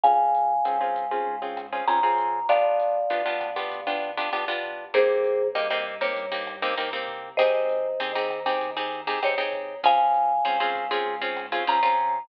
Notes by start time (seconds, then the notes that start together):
0.03 C#2 C4 C#4 F4 G#4 F5 G#5, kick, closed hi-hat
0.35 closed hi-hat
0.65 G#2 C4 C#4 F4 G#4, cross-stick, closed hi-hat
0.81 C4 C#4 F4 G#4
0.96 kick, closed hi-hat
1.11 C4 C#4 F4 G#4
1.27 G#2
1.42 C4 C#4 F4 G#4
1.57 cross-stick, closed hi-hat
1.72 C4 C#4 F4 G#4
1.87 C#2 C4 C#4 F4 G#4 A#5, closed hi-hat
2.03 C4 C#4 F4 G#4
2.18 kick, closed hi-hat
2.49 G1 B3 D4 F4 G4 D5 F5, kick, cross-stick, closed hi-hat
2.80 closed hi-hat
3.10 D2 B3 D4 F4 G4, closed hi-hat
3.26 B3 D4 F4 G4
3.41 kick, cross-stick, closed hi-hat
3.56 B3 D4 F4 G4
3.72 D2, kick, closed hi-hat
3.87 B3 D4 F4 G4
4.02 closed hi-hat
4.17 B3 D4 F4 G4
4.33 G1 B3 D4 F4 G4, cross-stick, closed hi-hat
4.48 B3 D4 F4 G4
4.63 kick, closed hi-hat
4.94 C2 A#3 C4 D#4 G4 G#4 C5, kick, closed hi-hat
5.24 closed hi-hat
5.55 G2 A#3 C4 D#4 G4 D#5, cross-stick, closed hi-hat
5.70 A#3 C4 D#4 G4 D#5
5.86 kick, closed hi-hat
6.01 A#3 C4 D#4 G4 C#5
6.16 G2, kick, closed hi-hat
6.32 A#3 C4 D#4 G4
6.47 cross-stick, closed hi-hat
6.62 A#3 C4 D#4 G4
6.77 C2 A#3 C4 D#4 G4, closed hi-hat
6.93 A#3 C4 D#4 G4
7.08 kick, closed hi-hat
7.37 G#1 C4 D#4 G4 G#4 C5 D#5, kick, cross-stick, closed hi-hat
7.69 closed hi-hat
8.00 D#2 C4 D#4 G4 G#4, closed hi-hat
8.15 C4 D#4 G4 G#4
8.30 kick, cross-stick, closed hi-hat
8.46 C4 D#4 G4 G#4
8.61 D#2, kick, closed hi-hat
8.77 C4 D#4 G4 G#4
8.92 closed hi-hat
9.07 C4 D#4 G4 G#4
9.22 G#1 C4 D#4 G4 G#4 C#5, cross-stick, closed hi-hat
9.38 C4 D#4 G4 G#4
9.53 kick, closed hi-hat
9.83 C#2 C4 C#4 F4 G#4 F5 G#5, kick, closed hi-hat
10.14 closed hi-hat
10.45 G#2 C4 C#4 F4 G#4, cross-stick, closed hi-hat
10.60 C4 C#4 F4 G#4
10.75 kick, closed hi-hat
10.91 C4 C#4 F4 G#4
11.06 G#2
11.21 C4 C#4 F4 G#4
11.36 cross-stick, closed hi-hat
11.52 C4 C#4 F4 G#4
11.67 C#2 C4 C#4 F4 G#4 A#5, closed hi-hat
11.83 C4 C#4 F4 G#4
11.98 kick, closed hi-hat